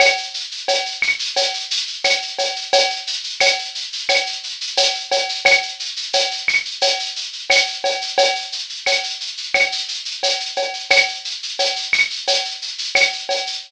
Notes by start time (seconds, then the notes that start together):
0.00 cowbell, claves, shaker
0.17 shaker
0.34 shaker
0.51 shaker
0.68 cowbell, shaker
0.86 shaker
1.02 claves, shaker
1.19 shaker
1.36 cowbell, shaker
1.54 shaker
1.71 shaker
1.87 shaker
2.04 cowbell, claves, shaker
2.22 shaker
2.38 cowbell, shaker
2.56 shaker
2.73 cowbell, shaker
2.90 shaker
3.07 shaker
3.24 shaker
3.40 cowbell, claves, shaker
3.59 shaker
3.75 shaker
3.92 shaker
4.09 cowbell, claves, shaker
4.26 shaker
4.43 shaker
4.61 shaker
4.77 cowbell, shaker
4.94 shaker
5.12 cowbell, shaker
5.29 shaker
5.45 cowbell, claves, shaker
5.62 shaker
5.80 shaker
5.96 shaker
6.13 cowbell, shaker
6.31 shaker
6.48 claves, shaker
6.65 shaker
6.81 cowbell, shaker
6.99 shaker
7.16 shaker
7.33 shaker
7.50 cowbell, claves, shaker
7.67 shaker
7.84 cowbell, shaker
8.01 shaker
8.18 cowbell, shaker
8.35 shaker
8.52 shaker
8.69 shaker
8.86 cowbell, claves, shaker
9.04 shaker
9.20 shaker
9.37 shaker
9.54 cowbell, claves, shaker
9.72 shaker
9.88 shaker
10.05 shaker
10.23 cowbell, shaker
10.40 shaker
10.56 cowbell, shaker
10.74 shaker
10.90 cowbell, claves, shaker
11.08 shaker
11.25 shaker
11.43 shaker
11.59 cowbell, shaker
11.76 shaker
11.93 claves, shaker
12.10 shaker
12.27 cowbell, shaker
12.44 shaker
12.62 shaker
12.78 shaker
12.95 cowbell, claves, shaker
13.13 shaker
13.29 cowbell, shaker
13.47 shaker